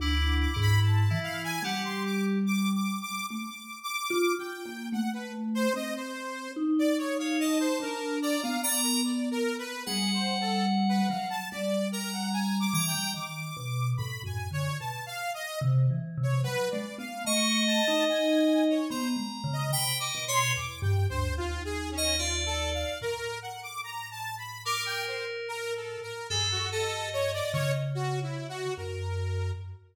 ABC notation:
X:1
M:4/4
L:1/16
Q:1/4=73
K:none
V:1 name="Electric Piano 2"
(3E4 E4 E4 G4 z4 | z16 | z3 ^c a4 ^a2 a2 z4 | ^f8 z2 ^a4 a2 |
z16 | z4 ^d8 ^a4 | (3g2 ^d2 ^c2 z7 d =d4 | z8 ^A8 |
A2 ^d6 z8 |]
V:2 name="Lead 2 (sawtooth)"
d'2 d' b a2 f ^g ^f c' d' z (3d'2 d'2 d'2 | (3d'4 d'4 g4 ^f B z c ^d c3 | z d ^c f ^d =c ^A2 =d f d A (3d2 A2 B2 | (3^G2 c2 A2 z B f a d2 ^A ^f (3^g2 d'2 =g2 |
d'4 (3b2 ^g2 ^c2 (3a2 f2 ^d2 z3 c | (3B2 d2 f2 ^c'2 a2 ^g3 ^c =c z2 ^d | (3b2 d'2 c'2 (3d'2 g2 c2 (3F2 ^G2 ^C2 (3F2 A2 f2 | ^A2 ^f d' (3^a2 =a2 b2 d' g c z (3^A2 =A2 ^A2 |
^G ^F A2 ^c d c z (3F2 E2 F2 ^A4 |]
V:3 name="Vibraphone"
(3D,,4 ^G,,4 E,4 =G,8 | A, z3 (3F2 F2 ^A,2 =A,4 C4 | ^D6 =D3 B,7 | G,6 ^F,2 G,6 E, G, |
^D,2 B,,2 (3A,,2 ^F,,2 =D,2 B,, z3 (3C,2 E,2 C,2 | (3^F,2 ^G,2 B,2 A,3 ^D5 (3B,2 G,2 ^C,2 | C,2 B,,2 (3E,,2 G,,2 D,,2 ^D,,8 | A,,16 |
G,,6 ^C,6 ^F,,4 |]